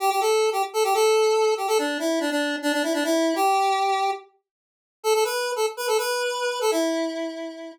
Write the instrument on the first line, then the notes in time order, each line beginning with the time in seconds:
lead 1 (square)
0.00 G4
0.10 G4
0.21 A4
0.52 G4
0.73 A4
0.84 G4
0.94 A4
1.57 G4
1.68 A4
1.78 D4
1.99 E4
2.20 D4
2.31 D4
2.62 D4
2.73 D4
2.83 E4
2.94 D4
3.04 E4
3.36 G4
5.03 A4
5.14 A4
5.24 B4
5.56 A4
5.77 B4
5.87 A4
5.98 B4
6.61 A4
6.71 E4